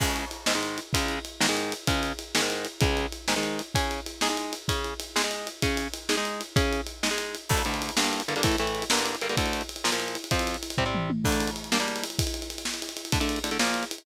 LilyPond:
<<
  \new Staff \with { instrumentName = "Overdriven Guitar" } { \time 6/8 \key cis \minor \tempo 4. = 128 <cis, cis gis>4. <gis, dis gis>16 <gis, dis gis>4~ <gis, dis gis>16 | <cis, cis gis>4. <gis, dis gis>16 <gis, dis gis>4~ <gis, dis gis>16 | <cis, cis gis>4. <gis, dis gis>16 <gis, dis gis>4~ <gis, dis gis>16 | <cis, cis gis>4. <gis, dis gis>16 <gis, dis gis>4~ <gis, dis gis>16 |
<cis cis' gis'>4. <gis dis' gis'>16 <gis dis' gis'>4~ <gis dis' gis'>16 | <cis cis' gis'>4. <gis dis' gis'>16 <gis dis' gis'>4~ <gis dis' gis'>16 | <cis cis' gis'>4. <gis dis' gis'>16 <gis dis' gis'>4~ <gis dis' gis'>16 | <cis cis' gis'>4. <gis dis' gis'>16 <gis dis' gis'>4~ <gis dis' gis'>16 |
\key d \minor <d, d a>8 <d, d a>4 <g, d bes>4 <g, d bes>16 <g, d bes>16 | <a, e a>8 <a, e a>4 <g, d bes>4 <g, d bes>16 <g, d bes>16 | <d, d a>4. <bes, f bes>16 <bes, f bes>4~ <bes, f bes>16 | <f, f c'>4. <c g c'>16 <c g c'>4~ <c g c'>16 |
<d a d'>4. <g bes d'>16 <g bes d'>4~ <g bes d'>16 | r2. | <d a d'>16 <d a d'>8. <d a d'>16 <d a d'>16 <bes, f bes>4. | }
  \new DrumStaff \with { instrumentName = "Drums" } \drummode { \time 6/8 <cymc bd>8 cymr8 cymr8 sn8 cymr8 cymr8 | <bd cymr>8 cymr8 cymr8 sn8 cymr8 cymr8 | <bd cymr>8 cymr8 cymr8 sn8 cymr8 cymr8 | <bd cymr>8 cymr8 cymr8 sn8 cymr8 cymr8 |
<bd cymr>8 cymr8 cymr8 sn8 cymr8 cymr8 | <bd cymr>8 cymr8 cymr8 sn8 cymr8 cymr8 | <bd cymr>8 cymr8 cymr8 sn8 cymr8 cymr8 | <bd cymr>8 cymr8 cymr8 sn8 cymr8 cymr8 |
<cymc bd>16 cymr16 cymr16 cymr16 cymr16 cymr16 sn16 cymr16 cymr16 cymr16 cymr16 cymr16 | <bd cymr>16 cymr16 cymr16 cymr16 cymr16 cymr16 sn16 cymr16 cymr16 cymr16 cymr16 cymr16 | <bd cymr>16 cymr16 cymr16 cymr16 cymr16 cymr16 sn16 cymr16 cymr16 cymr16 cymr16 cymr16 | <bd cymr>16 cymr16 cymr16 cymr16 cymr16 cymr16 <bd tomfh>8 toml8 tommh8 |
<cymc bd>16 cymr16 cymr16 cymr16 cymr16 cymr16 sn16 cymr16 cymr16 cymr16 cymr16 cymr16 | <bd cymr>16 cymr16 cymr16 cymr16 cymr16 cymr16 sn16 cymr16 cymr16 cymr16 cymr16 cymr16 | <bd cymr>16 cymr16 cymr16 cymr16 cymr16 cymr16 sn16 cymr16 cymr16 cymr16 cymr16 cymr16 | }
>>